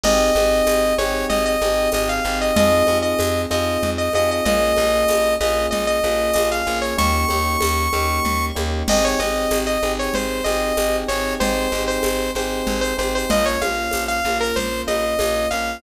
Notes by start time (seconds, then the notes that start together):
0.04 G#1 C4 D#4 G4 G#4 D#5, crash, low conga
0.35 G#1 C4 D#4 G4 G#4, high conga
0.67 G#1, tambourine, high conga
0.98 G#1 C4 D#4 G4 G#4 C#5, high conga
1.29 G#1 D#5, low conga
1.46 D#5
1.62 G#1 C4 D#4 G4 G#4, high conga
1.92 G#1 C4 D#4 G4 G#4 D#5, tambourine, high conga
2.09 F5
2.25 G#1 C4 D#4 G4 G#4
2.41 D#5
2.56 F2 C4 D#4 F4 G#4 D#5, low conga
2.87 F2 C4 D#4 F4 G#4, high conga
3.02 D#5
3.19 F2, tambourine, high conga
3.50 F2 C4 D#4 F4 G#4 D#5, high conga
3.83 F2, low conga
3.98 D#5
4.13 F2 C4 D#4 F4 G#4 D#5, high conga
4.31 D#5
4.45 A#1 A#3 C#4 F4 G#4 D#5, low conga
4.77 A#1 A#3 C#4 F4 G#4, high conga
5.08 A#1, tambourine, high conga
5.41 A#1 A#3 C#4 F4 G#4 D#5, high conga
5.71 A#1 D#5, low conga
5.87 D#5
6.04 A#1 A#3 C#4 F4 G#4, high conga
6.34 A#1 A#3 C#4 F4 G#4 D#5, tambourine, high conga
6.51 F5
6.66 A#1 A#3 C#4 F4 G#4
6.82 C#5
6.98 D#2 A#3 C#4 D#4 G4 C#6, low conga
7.29 D#2 A#3 C#4 D#4 G4, high conga
7.61 D#2, tambourine, high conga
7.93 D#2 A#3 C#4 D#4 G4, high conga
8.25 D#2, low conga
8.55 D#2 A#3 C#4 D#4 G4, high conga
8.88 G#1 C4 D#4 G4 G#4 D#5, crash, low conga
9.04 C#5
9.19 G#1 C4 D#4 G4 G#4 D#5, high conga
9.51 G#1, tambourine, high conga
9.67 D#5
9.83 G#1 C4 D#4 G4 G#4, high conga
9.99 C#5
10.14 G#1 C5, low conga
10.44 G#1 C4 D#4 G4 G#4 D#5, high conga
10.77 G#1 C4 D#4 G4 G#4, tambourine, high conga
11.08 G#1 C4 D#4 G4 G#4 C#5
11.40 G#1 C4 D#4 G4 G#4 C5, low conga
11.72 G#1 C4 D#4 G4 G#4, high conga
11.88 C5
12.03 G#1, tambourine, high conga
12.35 G#1 C4 D#4 G4 G#4 C5, high conga
12.67 G#1, low conga
12.81 C5
12.97 G#1 C4 D#4 G4 G#4 C5, high conga
13.15 C5
13.29 A#1 A#3 C#4 F4 D#5, low conga
13.46 C#5
13.61 A#1 A#3 C#4 F4 F5, high conga
13.91 A#1, tambourine, high conga
14.08 F5
14.25 A#1 A#3 C#4 F4, high conga
14.41 A#4
14.56 A#1 C5, low conga
14.87 A#1 A#3 C#4 F4 D#5, high conga
15.19 A#1 A#3 C#4 F4, tambourine, high conga
15.51 A#1 A#3 C#4 F4 F5